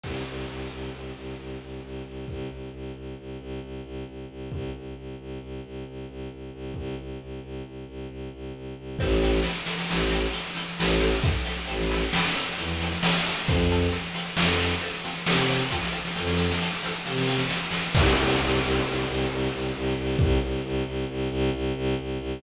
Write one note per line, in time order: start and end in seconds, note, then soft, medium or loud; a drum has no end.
0.03 0.23 C2 medium
0.03 kick medium
0.03 crash medium
0.26 0.46 C2 medium
0.49 0.68 C2 medium
0.71 0.90 C2 medium
0.93 1.12 C2 medium
1.16 1.35 C2 medium
1.38 1.57 C2 medium
1.61 1.80 C2 medium
1.83 2.02 C2 medium
2.06 2.25 C2 medium
2.28 2.47 C2 medium
2.28 kick medium
2.50 2.69 C2 medium
2.73 2.92 C2 medium
2.95 3.14 C2 medium
3.18 3.37 C2 medium
3.40 3.59 C2 medium
3.62 3.81 C2 medium
3.84 4.03 C2 medium
4.07 4.26 C2 medium
4.29 4.48 C2 medium
4.52 4.71 C2 medium
4.52 kick medium
4.75 4.94 C2 medium
4.96 5.15 C2 medium
5.19 5.38 C2 medium
5.42 5.61 C2 medium
5.64 5.83 C2 medium
5.87 6.06 C2 medium
6.09 6.28 C2 medium
6.31 6.50 C2 medium
6.53 6.72 C2 medium
6.74 6.95 C2 medium
6.74 kick medium
6.99 7.18 C2 medium
7.21 7.40 C2 medium
7.43 7.62 C2 medium
7.65 7.84 C2 medium
7.88 8.07 C2 medium
8.09 8.28 C2 medium
8.33 8.52 C2 medium
8.54 8.74 C2 medium
8.78 8.97 C2 medium
8.99 9.40 A1 loud
8.99 9.09 C4 loud
8.99 9.09 E4 loud
8.99 9.09 A4 loud
8.99 kick loud
8.99 snare medium
9.11 snare medium
9.22 9.31 C4 loud
9.22 9.31 E4 loud
9.22 9.31 A4 loud
9.22 snare medium
9.34 snare medium
9.43 9.53 C4 loud
9.43 9.53 E4 loud
9.43 9.53 A4 loud
9.43 snare loud
9.56 snare medium
9.66 9.75 C4 loud
9.66 9.75 E4 loud
9.66 9.75 A4 loud
9.66 snare medium
9.78 snare medium
9.89 10.26 A1 medium
9.89 9.98 C4 loud
9.89 9.98 E4 loud
9.89 9.98 A4 loud
9.89 snare loud
10.00 snare medium
10.10 10.20 C4 loud
10.10 10.20 E4 loud
10.10 10.20 A4 loud
10.10 snare medium
10.23 snare medium
10.33 10.42 C4 loud
10.33 10.42 E4 loud
10.33 10.42 A4 medium
10.33 snare medium
10.46 snare medium
10.55 10.64 C4 loud
10.55 10.64 E4 loud
10.55 10.64 A4 loud
10.55 snare medium
10.69 snare medium
10.79 11.14 A1 loud
10.79 10.87 C4 loud
10.79 10.87 E4 loud
10.79 10.87 A4 loud
10.79 snare loud
10.89 snare medium
11.00 11.09 C4 loud
11.00 11.09 E4 loud
11.00 11.09 A4 loud
11.00 snare medium
11.11 snare medium
11.23 11.33 C4 medium
11.23 11.33 E4 loud
11.23 11.33 A4 loud
11.23 kick loud
11.23 snare medium
11.34 snare medium
11.46 11.55 C4 loud
11.46 11.55 E4 loud
11.46 11.55 A4 loud
11.46 snare medium
11.57 snare medium
11.67 12.04 A1 medium
11.67 11.76 C4 loud
11.67 11.76 E4 loud
11.67 11.76 A4 loud
11.67 snare medium
11.81 snare medium
11.90 11.99 C4 loud
11.90 11.99 E4 loud
11.90 11.99 A4 loud
11.90 snare medium
12.01 snare medium
12.13 12.23 C4 loud
12.13 12.23 E4 loud
12.13 12.23 A4 loud
12.13 snare loud
12.23 snare medium
12.35 12.45 C4 loud
12.35 12.45 E4 loud
12.35 12.45 A4 loud
12.35 snare medium
12.47 snare medium
12.58 12.94 E2 medium
12.58 12.67 C4 medium
12.58 12.67 E4 loud
12.58 12.67 A4 loud
12.58 snare medium
12.69 snare medium
12.80 12.90 C4 loud
12.80 12.90 E4 loud
12.80 12.90 A4 loud
12.80 snare medium
12.92 snare medium
13.02 13.11 C4 loud
13.02 13.11 E4 loud
13.02 13.11 A4 loud
13.02 snare loud
13.13 snare medium
13.24 13.33 C4 loud
13.24 13.33 E4 loud
13.24 13.33 A4 loud
13.24 snare medium
13.35 snare medium
13.47 13.88 F2 loud
13.47 13.57 C4 loud
13.47 13.57 F4 loud
13.47 13.57 A4 loud
13.47 kick loud
13.47 snare medium
13.58 snare medium
13.70 13.79 C4 loud
13.70 13.79 F4 loud
13.70 13.79 A4 loud
13.70 snare medium
13.81 snare medium
13.92 14.01 C4 loud
13.92 14.01 F4 loud
13.92 14.01 A4 loud
13.92 snare medium
14.04 snare medium
14.14 14.24 C4 loud
14.14 14.24 F4 loud
14.14 14.24 A4 medium
14.14 snare medium
14.26 snare medium
14.36 14.72 F2 medium
14.36 14.47 C4 loud
14.36 14.47 F4 loud
14.36 14.47 A4 loud
14.36 snare loud
14.49 snare medium
14.58 14.69 C4 loud
14.58 14.69 F4 loud
14.58 14.69 A4 medium
14.58 snare medium
14.71 snare medium
14.80 14.90 C4 loud
14.80 14.90 F4 loud
14.80 14.90 A4 loud
14.80 snare medium
14.94 snare medium
15.04 15.13 C4 loud
15.04 15.13 F4 loud
15.04 15.13 A4 medium
15.04 snare medium
15.15 snare medium
15.26 15.62 C3 medium
15.26 15.36 C4 loud
15.26 15.36 F4 loud
15.26 15.36 A4 loud
15.26 snare loud
15.38 snare medium
15.49 15.58 C4 loud
15.49 15.58 F4 loud
15.49 15.58 A4 loud
15.49 snare medium
15.60 snare medium
15.71 15.81 C4 loud
15.71 15.81 F4 loud
15.71 15.81 A4 loud
15.71 kick medium
15.71 snare medium
15.83 snare medium
15.92 16.01 C4 loud
15.92 16.01 F4 loud
15.92 16.01 A4 loud
16.05 snare medium
16.15 16.52 F2 medium
16.15 16.24 C4 loud
16.15 16.24 F4 loud
16.15 16.24 A4 loud
16.15 snare medium
16.27 snare loud
16.37 16.46 C4 loud
16.37 16.46 F4 loud
16.37 16.46 A4 loud
16.37 snare medium
16.51 snare loud
16.60 16.70 C4 loud
16.60 16.70 F4 loud
16.60 16.70 A4 loud
16.60 snare medium
16.72 snare medium
16.83 16.93 C4 loud
16.83 16.93 F4 loud
16.83 16.93 A4 loud
16.83 snare medium
17.05 17.42 C3 loud
17.05 17.14 C4 loud
17.05 17.14 F4 loud
17.05 17.14 A4 loud
17.05 snare medium
17.18 snare loud
17.27 17.37 C4 loud
17.27 17.37 F4 loud
17.27 17.37 A4 loud
17.27 snare medium
17.38 snare loud
17.49 17.58 C4 loud
17.49 17.58 F4 loud
17.49 17.58 A4 loud
17.49 snare loud
17.71 17.81 C4 loud
17.71 17.81 F4 loud
17.71 17.81 A4 loud
17.71 snare loud
17.95 18.15 C2 loud
17.95 kick loud
17.95 crash loud
18.17 18.36 C2 loud
18.40 18.59 C2 loud
18.62 18.81 C2 loud
18.85 19.04 C2 loud
19.07 19.26 C2 loud
19.29 19.49 C2 loud
19.52 19.71 C2 loud
19.75 19.94 C2 loud
19.97 20.16 C2 loud
20.19 20.38 C2 loud
20.19 kick loud
20.41 20.60 C2 loud
20.64 20.83 C2 loud
20.86 21.05 C2 loud
21.09 21.28 C2 loud
21.31 21.50 C2 loud
21.53 21.72 C2 loud
21.75 21.94 C2 loud
21.99 22.18 C2 loud
22.20 22.39 C2 loud